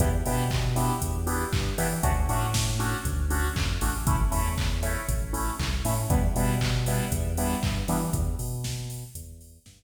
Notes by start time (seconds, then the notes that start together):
0.00 E2 B3 D4 E4 G4, kick, closed hi-hat
0.26 B2 B3 D4 E4 G4, open hi-hat
0.50 kick, clap
0.76 B3 D4 E4 G4, open hi-hat
1.01 E2, kick, closed hi-hat
1.26 B3 D4 E4 G4, open hi-hat
1.53 G2, kick, clap
1.78 E3 B3 D4 E4 G4, open hi-hat
2.03 D2 A3 C#4 D4 F#4, kick, closed hi-hat
2.29 A2 A3 C#4 D4 F#4, open hi-hat
2.54 kick, snare
2.79 A3 C#4 D4 F#4, open hi-hat
3.05 D2, kick, closed hi-hat
3.30 A3 C#4 D4 F#4, open hi-hat
3.56 F2, kick, clap
3.81 A1 A3 C#4 D4 F#4, open hi-hat
4.07 A3 C#4 E4, kick, closed hi-hat
4.31 E2 A3 C#4 E4, open hi-hat
4.57 kick, clap
4.83 A3 C#4 E4, open hi-hat
5.08 A1, kick, closed hi-hat
5.33 A3 C#4 E4, open hi-hat
5.59 C2, kick, clap
5.85 A2 A3 C#4 E4, open hi-hat
6.10 E2 G3 B3 D4 E4, kick, closed hi-hat
6.35 B2 G3 B3 D4 E4, open hi-hat
6.61 kick, clap
6.86 G3 B3 D4 E4, open hi-hat
7.12 E2, kick, closed hi-hat
7.37 G3 B3 D4 E4, open hi-hat
7.63 G2, kick, clap
7.88 E3 G3 B3 D4 E4, open hi-hat
8.13 E2, kick, closed hi-hat
8.39 B2, open hi-hat
8.64 kick, snare
8.90 open hi-hat
9.15 E2, kick, closed hi-hat
9.41 open hi-hat
9.66 G2, kick, snare